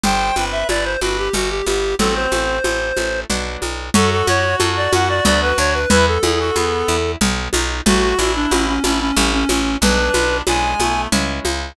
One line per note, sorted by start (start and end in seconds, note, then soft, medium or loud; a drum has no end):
0.04 0.31 G1 medium
0.04 0.33 G3 loud
0.04 0.35 C5 medium
0.04 0.45 G5 loud
0.04 low conga medium
0.36 0.64 G1 medium
0.36 0.65 C4 medium
0.36 0.92 B4 medium
0.36 high conga soft
0.52 0.67 E5 medium
0.69 0.97 G1 medium
0.69 0.98 E4 medium
0.69 0.84 D5 medium
0.69 high conga medium
0.85 1.00 C5 medium
1.01 1.29 G1 medium
1.01 1.31 C4 medium
1.01 1.17 F#4 medium
1.01 1.28 B4 medium
1.01 high conga medium
1.18 1.34 G4 medium
1.33 1.62 G1 loud
1.33 1.63 G3 loud
1.33 1.50 F#4 medium
1.33 low conga medium
1.50 1.66 G4 medium
1.66 1.94 G1 medium
1.66 1.96 B3 medium
1.66 1.95 G4 loud
1.66 high conga medium
1.99 2.27 A1 loud
1.99 2.29 F#3 loud
1.99 2.57 C4 loud
1.99 2.14 A4 loud
1.99 low conga medium
2.15 3.20 C5 medium
2.32 2.60 A1 medium
2.32 2.61 A3 medium
2.32 high conga medium
2.64 2.92 A1 medium
2.64 2.94 C4 medium
2.64 high conga medium
2.97 3.25 A1 medium
2.97 3.26 A3 medium
2.97 high conga medium
3.30 3.57 B1 medium
3.30 3.89 F#3 medium
3.30 3.89 B3 medium
3.30 3.89 D4 loud
3.30 low conga medium
3.62 3.90 B1 medium
3.62 high conga medium
3.94 4.23 F#2 loud
3.94 4.24 C#4 loud
3.94 5.79 F#4 loud
3.94 4.11 A4 loud
3.94 low conga loud
4.11 4.26 A4 loud
4.27 4.55 F#2 loud
4.27 4.57 F#4 loud
4.27 4.56 C#5 loud
4.27 high conga medium
4.60 4.88 F#2 loud
4.60 4.89 A4 loud
4.60 high conga medium
4.77 4.92 D5 medium
4.93 5.20 F#2 loud
4.93 5.22 F#4 loud
4.93 5.08 F#5 loud
4.93 high conga medium
5.09 5.25 D5 loud
5.25 5.53 D2 loud
5.25 5.55 B3 loud
5.25 5.41 D5 loud
5.25 low conga medium
5.42 5.58 B4 loud
5.58 5.86 D2 loud
5.58 5.87 D4 medium
5.58 5.74 C#5 loud
5.74 5.90 B4 loud
5.90 6.18 E2 loud
5.90 6.20 B3 loud
5.90 6.05 E4 loud
5.90 6.06 B4 loud
5.90 low conga medium
6.07 7.12 A4 medium
6.23 6.51 E2 loud
6.23 6.52 E4 medium
6.23 6.39 G#4 medium
6.23 high conga medium
6.40 6.56 F#4 medium
6.55 6.84 E2 medium
6.55 6.97 B3 loud
6.55 6.85 G#4 medium
6.55 high conga medium
6.88 7.16 E2 loud
6.88 7.18 E4 loud
7.21 7.49 B1 loud
7.21 7.51 B3 loud
7.21 low conga medium
7.53 7.81 B1 loud
7.53 7.83 D#4 loud
7.53 high conga medium
7.86 8.14 A1 loud
7.86 8.15 A3 loud
7.86 8.33 F#4 loud
7.86 8.18 F#4 loud
7.86 low conga medium
8.17 8.46 A1 loud
8.17 8.48 D4 medium
8.17 8.72 E4 medium
8.17 high conga medium
8.36 8.51 D4 loud
8.51 8.79 A1 loud
8.51 8.67 C#4 medium
8.51 8.81 F#4 loud
8.51 high conga medium
8.68 8.83 C#4 medium
8.83 9.12 A1 loud
8.83 8.99 C#4 loud
8.83 9.13 D4 loud
8.83 9.11 E4 medium
8.83 high conga medium
9.00 9.16 C#4 loud
9.16 9.44 A1 loud
9.16 9.46 A3 loud
9.16 9.32 C#4 loud
9.16 low conga medium
9.33 9.49 C#4 loud
9.49 9.77 A1 loud
9.49 9.77 C#4 medium
9.49 9.79 C#4 loud
9.49 high conga medium
9.81 10.10 B1 loud
9.81 10.11 G#3 loud
9.81 10.41 D4 loud
9.81 10.37 B4 loud
9.81 low conga medium
10.14 10.42 B1 loud
10.14 10.43 B3 medium
10.14 high conga medium
10.47 10.75 B1 loud
10.47 10.80 G#3 medium
10.47 10.77 D4 loud
10.47 11.02 G#5 loud
10.47 high conga medium
10.80 11.07 B1 medium
10.80 11.08 A3 medium
10.80 11.09 B3 loud
10.80 high conga medium
11.12 11.40 C#2 loud
11.12 11.71 G#3 loud
11.12 11.71 C#4 loud
11.12 11.71 E4 loud
11.12 low conga medium
11.45 11.73 C#2 loud
11.45 high conga medium